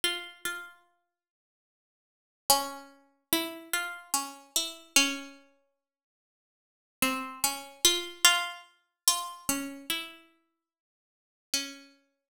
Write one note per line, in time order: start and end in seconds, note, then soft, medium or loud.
0.04 0.41 F4 medium
0.45 1.56 F4 medium
2.50 3.24 C#4 loud
3.33 3.70 E4 loud
3.73 4.10 F4 medium
4.14 4.51 C#4 medium
4.56 4.93 E4 medium
4.96 6.81 C#4 medium
7.02 7.39 C4 medium
7.44 7.81 C#4 medium
7.85 8.22 F4 loud
8.24 8.61 F4 loud
9.08 9.45 F4 loud
9.49 9.86 C#4 medium
9.90 11.38 E4 medium
11.54 12.28 C#4 medium